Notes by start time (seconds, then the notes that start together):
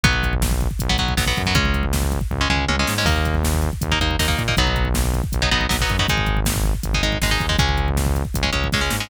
0.04 B1 F#3 B3, kick, closed hi-hat
0.13 kick
0.23 kick, closed hi-hat
0.33 kick
0.42 kick, snare
0.51 kick
0.61 kick, closed hi-hat
0.71 kick
0.79 B1, kick, closed hi-hat
0.89 F#3 B3, kick
0.98 B1 F#3 B3, kick, closed hi-hat
1.08 kick
1.17 B1 F#3 B3, kick, snare
1.27 F#3 B3, kick
1.37 F#2, kick, closed hi-hat
1.46 F#3 B3, kick
1.55 C#2 G#3 C#4, kick, closed hi-hat
1.65 kick
1.74 kick, closed hi-hat
1.83 kick
1.93 kick, snare
2.02 kick
2.12 kick, closed hi-hat
2.21 kick
2.31 C#2, kick, floor tom
2.41 G#3 C#4
2.50 C#2 G#3 C#4, mid tom
2.68 C#2 G#3 C#4, high tom
2.79 G#3 C#4
2.87 G#2, snare
2.98 G#3 C#4
3.05 D#2 A#3 D#4, kick, crash
3.16 kick
3.25 kick, closed hi-hat
3.35 kick
3.44 kick, snare
3.54 kick
3.62 kick, closed hi-hat
3.73 kick
3.81 D#2, kick, closed hi-hat
3.92 A#3 D#4, kick
4.00 D#2 A#3 D#4, kick, closed hi-hat
4.11 kick
4.19 D#2 A#3 D#4, kick, snare
4.28 A#3 D#4, kick
4.38 A#2, kick, closed hi-hat
4.48 A#3 D#4, kick
4.57 B1 F#3 B3 D#4, kick, closed hi-hat
4.67 kick
4.76 kick, closed hi-hat
4.85 kick
4.94 kick, snare
5.04 kick
5.14 kick, closed hi-hat
5.24 kick
5.32 B1, kick, closed hi-hat
5.42 F#3 B3 D#4, kick
5.51 B1 F#3 B3 D#4, kick, closed hi-hat
5.61 kick
5.69 B1 F#3 B3 D#4, kick, snare
5.80 F#3 B3 D#4, kick
5.89 F#2, kick, closed hi-hat
5.99 F#3 B3 D#4, kick
6.08 G#1 G#3 D#4, kick, closed hi-hat
6.18 kick
6.26 kick, closed hi-hat
6.37 kick
6.45 kick, snare
6.55 kick
6.64 kick, closed hi-hat
6.74 kick
6.83 G#1, kick, closed hi-hat
6.94 G#3 D#4, kick
7.02 G#1 G#3 D#4, kick, closed hi-hat
7.12 kick
7.22 G#1 G#3 D#4, kick, snare
7.31 G#3 D#4, kick
7.40 D#2, kick, closed hi-hat
7.49 G#3 D#4, kick
7.59 C#2 G#3 C#4, kick, closed hi-hat
7.69 kick
7.78 kick, closed hi-hat
7.88 kick
7.97 kick, snare
8.06 kick
8.15 kick, closed hi-hat
8.25 kick
8.34 C#2, kick, closed hi-hat
8.43 G#3 C#4, kick
8.53 C#2 G#3 C#4, kick, closed hi-hat
8.64 kick
8.72 C#2 G#3 C#4, kick, snare
8.81 G#3 C#4
8.90 G#2, snare
9.00 G#3 C#4